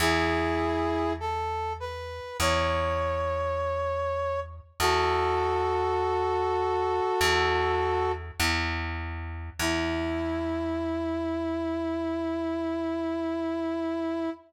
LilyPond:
<<
  \new Staff \with { instrumentName = "Brass Section" } { \time 4/4 \key e \major \tempo 4 = 50 <e' gis'>4 a'8 b'8 cis''2 | <fis' a'>2. r4 | e'1 | }
  \new Staff \with { instrumentName = "Electric Bass (finger)" } { \clef bass \time 4/4 \key e \major e,2 e,2 | e,2 e,4 e,4 | e,1 | }
>>